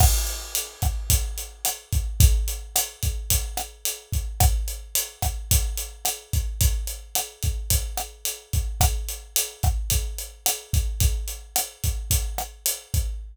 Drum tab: CC |x-------|--------|--------|--------|
HH |-xxxxxxx|xxxxxxxx|xxxxxxxx|xxxxxxxx|
SD |r--r--r-|--r--r--|r--r--r-|--r--r--|
BD |o--oo--o|o--oo--o|o--oo--o|o--oo--o|

CC |--------|--------|
HH |xxxxxxxx|xxxxxxxx|
SD |r--r--r-|--r--r--|
BD |o--oo--o|o--oo--o|